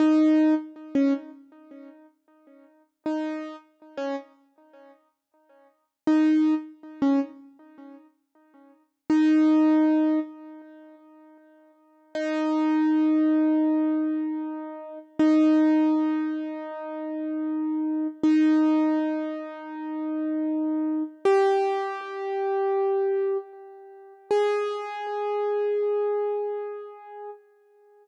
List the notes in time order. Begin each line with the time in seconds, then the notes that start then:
0.00 D#4
0.95 C#4
3.06 D#4
3.97 C#4
6.07 D#4
7.02 C#4
9.10 D#4
12.15 D#4
15.19 D#4
18.23 D#4
21.25 G4
24.31 G#4